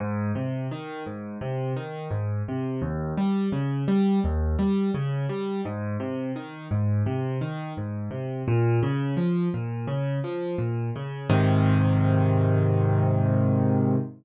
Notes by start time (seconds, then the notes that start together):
0.00 G#2
0.35 C3
0.71 D#3
1.06 G#2
1.41 C3
1.76 D#3
2.11 G#2
2.48 C3
2.82 D#2
3.17 G3
3.52 C#3
3.88 G3
4.24 D#2
4.59 G3
4.94 C#3
5.29 G3
5.65 G#2
6.00 C3
6.36 D#3
6.71 G#2
7.06 C3
7.41 D#3
7.77 G#2
8.11 C3
8.48 A#2
8.83 C#3
9.17 F3
9.54 A#2
9.87 C#3
10.24 F3
10.58 A#2
10.96 C#3
11.30 G#2 C3 D#3